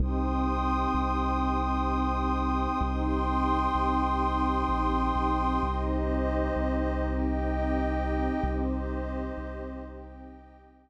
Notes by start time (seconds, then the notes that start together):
0.00 C2 C4 D#4 G4 G5 C6 D#6
0.94 C2
2.81 C2 C4 D#4 G4 G5 C6 D#6
3.75 C2
4.69 A#1
5.16 B1
5.61 C2 C4 D#4 G4 C5 D#5
6.56 C2
7.04 G4 D#5 G5
8.44 C2 C4 D#4 G4 C5 D#5
9.38 C2
9.83 G4 D#5 G5